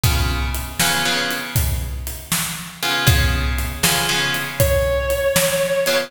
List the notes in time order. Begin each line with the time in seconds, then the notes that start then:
0.03 C#3 B3 F4 G#4, kick, closed hi-hat
0.55 closed hi-hat
0.80 C#3 B3 F4 G#4, snare
1.05 C#3 B3 F4 G#4
1.31 closed hi-hat
1.56 kick, closed hi-hat
2.07 closed hi-hat
2.32 snare
2.83 C#3 B3 F4 G#4, closed hi-hat
3.07 C#3 B3 F4 G#4, kick, closed hi-hat
3.58 closed hi-hat
3.83 C#3 B3 F4 G#4, snare
4.09 C#3 B3 F4 G#4
4.34 closed hi-hat
4.60 C#5, kick, closed hi-hat
5.10 closed hi-hat
5.36 snare
5.86 C#3 B3 F4 G#4, closed hi-hat